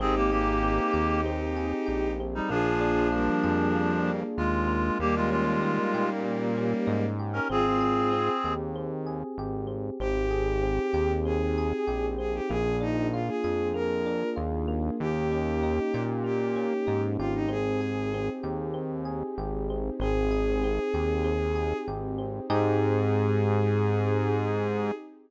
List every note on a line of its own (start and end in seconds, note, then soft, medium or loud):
0.00 0.80 G#1 medium
0.00 0.62 C4 medium
0.00 0.15 C4 medium
0.00 2.49 C4 medium
0.00 2.11 D#4 medium
0.00 2.49 D#4 medium
0.00 2.11 G4 medium
0.00 2.49 G4 medium
0.00 0.15 G#4 medium
0.00 2.49 G#4 medium
0.16 0.31 A#3 medium
0.16 0.31 G4 medium
0.31 1.21 A#3 medium
0.31 1.21 G4 medium
0.31 1.56 G#4 medium
0.63 1.25 C4 medium
0.93 1.74 D#2 medium
0.93 1.86 G4 medium
1.26 2.20 C4 medium
1.57 2.46 G#4 medium
1.86 2.41 A#1 medium
1.86 2.46 G4 medium
2.20 2.50 C4 medium
2.35 2.50 G3 medium
2.35 2.50 D#4 medium
2.49 3.30 A#1 medium
2.49 4.11 F3 medium
2.49 3.75 A#3 medium
2.49 4.97 A#3 medium
2.49 4.11 D4 medium
2.49 4.97 D4 medium
2.49 3.08 F4 loud
2.49 4.97 F4 medium
2.49 3.08 G#4 loud
2.49 4.97 G#4 medium
2.81 4.07 D4 medium
3.12 4.21 G3 medium
3.12 4.21 A#3 medium
3.12 4.38 F4 medium
3.43 4.24 F2 medium
3.43 4.92 G#4 medium
3.75 4.68 A#3 medium
4.08 4.97 D4 medium
4.37 4.91 D#2 medium
4.37 4.98 G#3 medium
4.37 4.98 F4 medium
4.68 6.24 A#3 medium
4.99 5.79 D#2 medium
4.99 7.04 G3 medium
4.99 7.04 A#3 loud
4.99 7.47 A#3 medium
4.99 5.15 A#3 medium
4.99 7.47 C#4 medium
4.99 7.47 D#4 medium
4.99 7.47 G4 medium
4.99 5.15 G4 medium
5.16 5.30 G#3 medium
5.16 5.30 F4 medium
5.31 6.10 G#3 medium
5.31 6.57 C#4 medium
5.31 6.10 F4 medium
5.63 6.87 D#4 medium
5.94 6.74 A#2 medium
5.94 7.19 G4 medium
6.24 7.43 A#3 medium
6.57 7.46 C#4 medium
6.87 7.40 G#2 medium
6.87 7.46 D#4 medium
7.19 7.49 G4 medium
7.33 7.48 C#4 medium
7.33 7.48 A#4 medium
7.49 8.30 G#1 medium
7.49 8.12 C4 medium
7.49 8.54 C4 medium
7.49 7.65 F4 medium
7.49 7.65 G#4 loud
7.49 8.54 G#4 medium
7.65 8.29 F4 medium
7.65 8.29 G#4 medium
7.80 9.06 G#4 medium
8.13 8.75 C4 medium
8.44 9.24 D#2 medium
8.44 9.38 G4 medium
8.76 9.67 C4 medium
9.07 9.96 G#4 medium
9.38 9.91 G#1 medium
9.38 9.98 G4 medium
9.67 9.97 C4 medium
9.99 10.80 G#1 medium
9.99 12.47 C4 medium
9.99 10.62 C4 medium
9.99 12.47 D#4 medium
9.99 12.47 G4 medium
9.99 11.12 G4 loud
9.99 12.47 G#4 medium
10.31 11.57 G#4 medium
10.63 11.25 C4 medium
10.93 11.73 D#2 medium
10.93 11.87 G4 medium
11.25 12.18 C4 medium
11.25 12.06 G#4 loud
11.58 12.47 G#4 medium
11.87 12.41 A#1 medium
11.87 12.47 G4 medium
12.18 12.48 C4 medium
12.18 12.34 G#4 medium
12.34 12.49 G4 loud
12.49 13.30 A#1 medium
12.49 14.97 A#3 medium
12.49 13.74 A#3 medium
12.49 14.97 D4 medium
12.49 14.97 F4 medium
12.49 14.97 G#4 loud
12.49 12.76 G#4 loud
12.81 14.06 D4 medium
12.81 13.07 D#4 loud
13.12 13.27 F4 medium
13.12 14.36 F4 medium
13.28 13.68 G#4 loud
13.44 14.24 F2 medium
13.44 14.92 G#4 medium
13.74 14.67 A#3 medium
13.74 14.29 A#4 loud
14.06 14.95 D4 medium
14.36 14.90 D#2 medium
14.36 14.96 F4 medium
14.68 16.24 A#3 medium
15.00 15.80 D#2 medium
15.00 17.47 A#3 medium
15.00 17.47 C#4 medium
15.00 17.47 D#4 medium
15.00 17.47 G4 medium
15.00 16.03 G4 loud
15.32 16.55 C#4 medium
15.63 16.86 D#4 medium
15.94 16.74 A#2 medium
15.94 17.19 G4 medium
16.24 17.43 A#3 medium
16.24 17.02 G4 medium
16.56 17.45 C#4 medium
16.87 17.17 G#2 medium
16.87 17.46 D#4 medium
17.18 18.30 G#1 medium
17.18 17.33 F4 loud
17.18 17.49 G4 medium
17.35 17.49 D#4 loud
17.48 18.14 C4 medium
17.48 19.97 C4 medium
17.48 19.97 D#4 medium
17.48 19.97 G4 medium
17.48 19.97 G#4 medium
17.48 18.27 G#4 loud
17.81 19.05 G#4 medium
18.14 18.73 C4 medium
18.43 19.23 D#2 medium
18.43 19.38 G4 medium
18.74 19.70 C4 medium
19.05 19.94 G#4 medium
19.38 19.91 G#1 medium
19.38 19.98 G4 medium
19.70 20.00 C4 medium
20.00 20.79 G#1 medium
20.00 22.48 C4 medium
20.00 20.64 C4 medium
20.00 22.48 D#4 medium
20.00 22.48 G4 medium
20.00 21.78 G#4 loud
20.00 22.48 G#4 medium
20.31 21.55 G#4 medium
20.64 21.24 C4 medium
20.94 21.73 D#2 medium
20.94 21.87 G4 medium
21.24 22.18 C4 medium
21.56 22.45 G#4 medium
21.87 22.40 G#1 medium
21.87 22.47 G4 medium
22.18 22.48 C4 medium
22.49 24.92 G#2 loud
22.49 24.91 C4 medium
22.49 24.92 C4 loud
22.49 24.91 D#4 loud
22.49 24.92 D#4 medium
22.49 24.91 G4 medium
22.49 24.92 G4 loud
22.49 24.91 G#4 loud
22.49 24.92 G#4 loud
22.49 24.92 G#4 medium